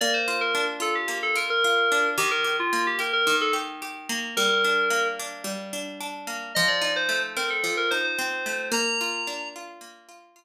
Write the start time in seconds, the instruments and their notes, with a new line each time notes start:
0.01 acoustic guitar (steel) A#3, electric piano 2 D5
0.14 electric piano 2 C5
0.28 acoustic guitar (steel) F4
0.41 electric piano 2 A#4
0.55 acoustic guitar (steel) D4
0.80 acoustic guitar (steel) F4, electric piano 2 A4
0.95 electric piano 2 G4
1.08 acoustic guitar (steel) A#3
1.23 electric piano 2 A4
1.36 acoustic guitar (steel) F4, electric piano 2 A#4
1.50 electric piano 2 A#4
1.64 acoustic guitar (steel) F4
1.92 acoustic guitar (steel) D4
2.18 acoustic guitar (steel) D#3, electric piano 2 G4
2.31 electric piano 2 A#4
2.44 acoustic guitar (steel) G4
2.59 electric piano 2 F4
2.73 acoustic guitar (steel) A#3
2.87 electric piano 2 G4
2.99 acoustic guitar (steel) G4, electric piano 2 A#4
3.13 electric piano 2 A#4
3.27 acoustic guitar (steel) D#3
3.41 electric piano 2 A4
3.53 acoustic guitar (steel) G4
3.82 acoustic guitar (steel) G4
4.09 acoustic guitar (steel) A#3
4.37 acoustic guitar (steel) G3, electric piano 2 A#4
4.64 acoustic guitar (steel) D4
4.90 acoustic guitar (steel) A#3
5.19 acoustic guitar (steel) D4
5.44 acoustic guitar (steel) G3
5.73 acoustic guitar (steel) D4
6.01 acoustic guitar (steel) D4
6.27 acoustic guitar (steel) A#3
6.55 acoustic guitar (steel) F3, electric piano 2 D#5
6.68 electric piano 2 D5
6.81 acoustic guitar (steel) D#4
6.96 electric piano 2 C5
7.09 acoustic guitar (steel) A3
7.36 acoustic guitar (steel) C4, electric piano 2 A#4
7.50 electric piano 2 A4
7.64 acoustic guitar (steel) F3
7.77 electric piano 2 A#4
7.91 acoustic guitar (steel) D#4, electric piano 2 C5
8.04 electric piano 2 C5
8.19 acoustic guitar (steel) C4
8.46 acoustic guitar (steel) A3
8.72 acoustic guitar (steel) A#3, electric piano 2 A#5
9.01 acoustic guitar (steel) F4
9.27 acoustic guitar (steel) D4
9.56 acoustic guitar (steel) F4
9.81 acoustic guitar (steel) A#3
10.09 acoustic guitar (steel) F4
10.36 acoustic guitar (steel) F4